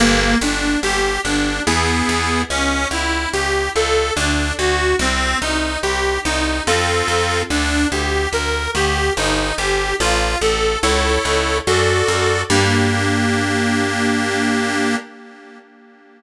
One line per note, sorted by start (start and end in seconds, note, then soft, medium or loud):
0.00 0.35 G1 loud
0.00 0.38 A#3 medium
0.41 0.77 G1 medium
0.41 0.80 D4 medium
0.83 1.18 G1 medium
0.83 1.21 G4 medium
1.24 1.60 G1 medium
1.24 1.62 D4 medium
1.67 2.02 E2 medium
1.67 2.42 B3 loud
1.67 2.42 E4 loud
1.67 2.42 G#4 loud
2.09 2.44 E2 medium
2.50 2.86 C#2 medium
2.50 2.88 C#4 loud
2.91 3.26 C#2 medium
2.91 3.29 E4 medium
3.33 3.69 C#2 medium
3.33 3.70 G4 medium
3.76 4.11 C#2 medium
3.76 4.13 A4 medium
4.16 4.52 D2 medium
4.16 4.53 D4 loud
4.59 4.94 D2 medium
4.59 4.96 F#4 medium
4.99 5.35 C2 medium
4.99 5.38 C4 medium
5.41 5.77 C2 medium
5.41 5.79 D#4 medium
5.83 6.19 C2 medium
5.83 6.20 G4 medium
6.25 6.61 C2 medium
6.25 6.63 D#4 medium
6.67 7.03 F2 medium
6.67 7.42 C4 loud
6.67 7.42 F4 loud
6.67 7.42 A4 loud
7.08 7.43 F2 medium
7.50 7.86 D2 medium
7.50 7.87 D4 loud
7.91 8.27 D2 medium
7.91 8.29 G4 medium
8.33 8.68 D2 medium
8.33 8.70 A#4 medium
8.75 9.10 D2 medium
8.75 9.13 G4 medium
9.17 9.52 G1 medium
9.17 9.55 D#4 medium
9.58 9.94 G1 medium
9.58 9.96 G4 medium
10.00 10.36 A1 medium
10.00 10.38 F4 medium
10.41 10.77 A1 medium
10.41 10.79 A4 medium
10.83 11.18 C#2 medium
10.83 11.58 E4 loud
10.83 11.58 A4 loud
10.83 11.58 C#5 medium
11.25 11.60 C#2 medium
11.67 12.03 F#2 medium
11.67 12.42 F#4 medium
11.67 12.42 A4 loud
11.67 12.42 D5 loud
12.08 12.44 F#2 medium
12.50 14.96 G2 loud
12.50 14.96 A#3 loud
12.50 14.96 D4 loud
12.50 14.96 G4 loud